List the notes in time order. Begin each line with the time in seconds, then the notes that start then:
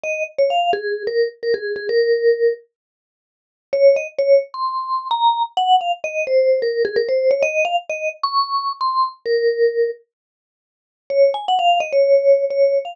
0.04 D#5
0.38 C#5
0.50 F5
0.73 G#4
1.07 A#4
1.43 A#4
1.54 G#4
1.76 G#4
1.89 A#4
3.73 C#5
3.96 D#5
4.19 C#5
4.54 C6
5.11 A#5
5.57 F#5
5.81 F5
6.04 D#5
6.27 C5
6.62 A#4
6.85 G#4
6.96 A#4
7.09 C5
7.31 C#5
7.42 D#5
7.65 F5
7.90 D#5
8.23 C#6
8.81 C6
9.26 A#4
11.10 C#5
11.34 G#5
11.48 F#5
11.59 F5
11.80 D#5
11.92 C#5
12.50 C#5
12.85 F5